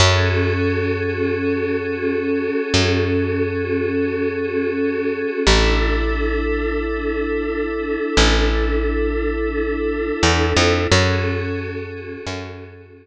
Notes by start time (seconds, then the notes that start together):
0.00 F#2 C#4 F#4 G#4 A4
2.74 F#2
5.45 A1 D4 E4 A4
8.17 A1
10.23 E2
10.57 F2
10.91 F#2 C#4 F#4 G#4 A4
12.27 F#2